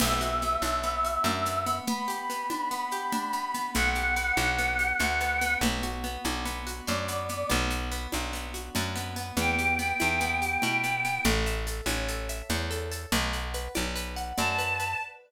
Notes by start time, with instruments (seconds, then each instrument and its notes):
0.00 electric bass (finger) B1, orchestral harp B3, choir aahs E5, crash, low conga, shaker
0.21 orchestral harp F#4, shaker
0.42 orchestral harp B3, shaker
0.62 electric bass (finger) B1, orchestral harp D4, high conga, shaker
0.83 orchestral harp B3, shaker
1.05 orchestral harp F#4, shaker
1.24 electric bass (finger) F#2, orchestral harp D4, low conga, shaker
1.46 orchestral harp B3, shaker
1.66 orchestral harp B3, shaker
1.87 orchestral harp B3, choir aahs B5, low conga, shaker
2.08 orchestral harp G4, shaker
2.30 orchestral harp B3, shaker
2.50 orchestral harp D4, high conga, shaker
2.71 orchestral harp B3, shaker
2.91 orchestral harp G4, shaker
3.12 orchestral harp D4, low conga, shaker
3.33 orchestral harp B3, shaker
3.54 orchestral harp B3, shaker
3.74 electric bass (finger) B1, orchestral harp B3, choir aahs F#5, low conga, shaker
3.95 orchestral harp G4, shaker
4.16 orchestral harp B3, shaker
4.37 electric bass (finger) B1, orchestral harp D4, high conga, shaker
4.58 orchestral harp B3, shaker
4.79 orchestral harp G4, shaker
4.99 electric bass (finger) D2, orchestral harp D4, low conga, shaker
5.20 orchestral harp B3, shaker
5.41 orchestral harp B3, shaker
5.61 electric bass (finger) B1, orchestral harp B3, low conga, shaker
5.83 orchestral harp F#4, shaker
6.04 orchestral harp B3, shaker
6.24 electric bass (finger) B1, orchestral harp D4, high conga, shaker
6.45 orchestral harp B3, shaker
6.67 orchestral harp F#4, shaker
6.87 electric bass (finger) F#2, orchestral harp D4, choir aahs D5, low conga, shaker
7.08 orchestral harp B3, shaker
7.29 orchestral harp B3, shaker
7.49 electric bass (finger) B1, orchestral harp B3, low conga, shaker
7.70 orchestral harp F#4, shaker
7.91 orchestral harp B3, shaker
8.12 electric bass (finger) B1, orchestral harp D4, high conga, shaker
8.33 orchestral harp B3, shaker
8.54 orchestral harp F#4, shaker
8.75 electric bass (finger) F#2, orchestral harp D4, low conga, shaker
8.95 orchestral harp B3, shaker
9.16 orchestral harp B3, shaker
9.37 electric bass (finger) E2, orchestral harp B3, choir aahs G5, low conga, shaker
9.59 orchestral harp G4, shaker
9.79 orchestral harp B3, shaker
10.00 electric bass (finger) E2, orchestral harp E4, high conga, shaker
10.20 orchestral harp B3, shaker
10.42 orchestral harp G4, shaker
10.62 electric bass (finger) B2, orchestral harp E4, low conga, shaker
10.84 orchestral harp B3, shaker
11.05 orchestral harp B3, shaker
11.24 electric bass (finger) A1, orchestral harp A4, low conga, shaker
11.46 orchestral harp E5, shaker
11.67 orchestral harp A4, shaker
11.86 electric bass (finger) A1, orchestral harp C#5, high conga, shaker
12.08 orchestral harp A4, shaker
12.29 orchestral harp E5, shaker
12.49 electric bass (finger) E2, orchestral harp C#5, low conga, shaker
12.71 orchestral harp A4, shaker
12.91 orchestral harp A4, shaker
13.12 electric bass (finger) B1, orchestral harp B4, low conga, shaker
13.33 orchestral harp F#5, shaker
13.54 orchestral harp B4, shaker
13.74 electric bass (finger) B1, orchestral harp D5, high conga, shaker
13.96 orchestral harp B4, shaker
14.16 orchestral harp F#5, shaker
14.37 electric bass (finger) F#2, orchestral harp D5, choir aahs A5, low conga, shaker
14.58 orchestral harp B4, shaker
14.79 orchestral harp B4, shaker